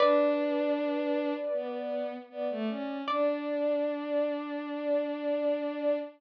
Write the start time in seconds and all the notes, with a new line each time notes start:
0.00 D4 B4 D5
1.53 B3
2.30 B3 D5
2.50 A3
2.69 C#4
3.08 D4 D5